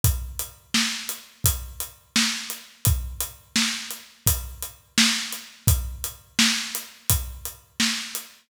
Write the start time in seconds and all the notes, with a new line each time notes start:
0.04 kick, closed hi-hat
0.39 closed hi-hat
0.74 snare
1.09 closed hi-hat
1.44 kick, closed hi-hat
1.80 closed hi-hat
2.16 snare
2.50 closed hi-hat
2.85 kick, closed hi-hat
3.20 closed hi-hat
3.56 snare
3.91 closed hi-hat
4.26 kick, closed hi-hat
4.62 closed hi-hat
4.98 snare
5.32 closed hi-hat
5.67 kick, closed hi-hat
6.04 closed hi-hat
6.39 snare
6.75 closed hi-hat
7.10 kick, closed hi-hat
7.45 closed hi-hat
7.80 snare
8.15 closed hi-hat